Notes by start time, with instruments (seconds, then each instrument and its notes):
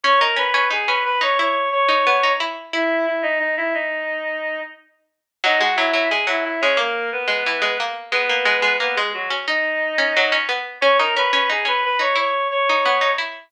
0.04 pizzicato strings C#4, clarinet C#5 C#6
0.20 pizzicato strings D#4, clarinet A#4 A#5
0.36 pizzicato strings C#4, clarinet B4 B5
0.54 pizzicato strings C#4
0.71 pizzicato strings D#4, clarinet G#4 G#5
0.87 pizzicato strings C#4, clarinet B4 B5
1.04 clarinet B4 B5
1.21 pizzicato strings D#4, clarinet C#5 C#6
1.39 pizzicato strings E4, clarinet C#5 C#6
1.72 clarinet C#5 C#6
1.88 pizzicato strings D#4
2.07 pizzicato strings B3
2.23 pizzicato strings D#4
2.40 pizzicato strings E4
2.73 clarinet E4 E5, pizzicato strings E4
3.06 clarinet E4 E5
3.22 clarinet D#4 D#5
3.39 clarinet D#4 D#5
3.57 clarinet E4 E5
3.74 clarinet D#4 D#5
5.44 pizzicato strings F#3, clarinet D#4 D#5
5.59 pizzicato strings G#3, clarinet F#4 F#5
5.76 pizzicato strings F#3, clarinet E4 E5
5.93 pizzicato strings F#3
6.10 pizzicato strings G#3, clarinet G#4 G#5
6.27 pizzicato strings F#3, clarinet E4 E5
6.44 clarinet E4 E5
6.61 pizzicato strings G#3, clarinet C#4 C#5
6.77 pizzicato strings A#3, clarinet A#3 A#4
7.12 clarinet B3 B4
7.28 pizzicato strings G#3
7.46 pizzicato strings E3
7.62 pizzicato strings G#3
7.80 pizzicato strings A#3
8.11 pizzicato strings G#3, clarinet B3 B4
8.29 pizzicato strings A#3
8.45 pizzicato strings G#3
8.62 pizzicato strings G#3
8.80 pizzicato strings A#3, clarinet B3 B4
8.96 clarinet G#3 G#4, pizzicato strings G#3
9.14 clarinet F#3 F#4
9.30 pizzicato strings C#4
9.47 clarinet D#4 D#5, pizzicato strings D#4
9.98 pizzicato strings C#4
10.17 pizzicato strings F#3
10.32 pizzicato strings C#4
10.49 pizzicato strings B3
10.81 pizzicato strings C#4, clarinet C#5 C#6
10.99 pizzicato strings D#4, clarinet A#4 A#5
11.16 pizzicato strings C#4, clarinet B4 B5
11.33 pizzicato strings C#4
11.49 pizzicato strings D#4, clarinet G#4 G#5
11.65 pizzicato strings C#4, clarinet B4 B5
11.85 clarinet B4 B5
11.99 pizzicato strings D#4, clarinet C#5 C#6
12.15 pizzicato strings E4, clarinet C#5 C#6
12.51 clarinet C#5 C#6
12.69 pizzicato strings D#4
12.85 pizzicato strings B3
13.01 pizzicato strings D#4
13.18 pizzicato strings E4